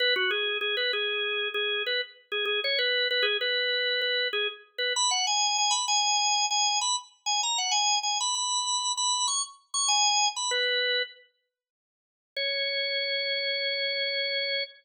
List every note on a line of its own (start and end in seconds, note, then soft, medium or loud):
0.00 0.14 B4 loud
0.16 0.31 F#4 loud
0.31 0.58 G#4 loud
0.61 0.76 G#4 loud
0.77 0.92 B4 loud
0.93 1.48 G#4 loud
1.54 1.83 G#4 loud
1.86 2.01 B4 loud
2.32 2.45 G#4 loud
2.45 2.60 G#4 loud
2.64 2.79 C#5 loud
2.79 3.08 B4 loud
3.11 3.25 B4 loud
3.23 3.37 G#4 loud
3.41 4.01 B4 loud
4.02 4.28 B4 loud
4.33 4.48 G#4 loud
4.78 4.93 B4 loud
4.96 5.11 B5 loud
5.11 5.26 F#5 loud
5.27 5.57 G#5 loud
5.58 5.73 G#5 loud
5.71 5.85 B5 medium
5.88 6.46 G#5 loud
6.51 6.79 G#5 loud
6.81 6.96 B5 loud
7.26 7.41 G#5 loud
7.43 7.58 A#5 loud
7.58 7.73 F#5 loud
7.71 7.99 G#5 loud
8.03 8.18 G#5 medium
8.20 8.35 B5 loud
8.35 8.92 B5 medium
8.97 9.26 B5 loud
9.28 9.42 C#6 loud
9.74 9.89 C#6 loud
9.88 10.28 G#5 loud
10.36 10.51 B5 medium
10.51 11.02 B4 loud
12.36 14.64 C#5 loud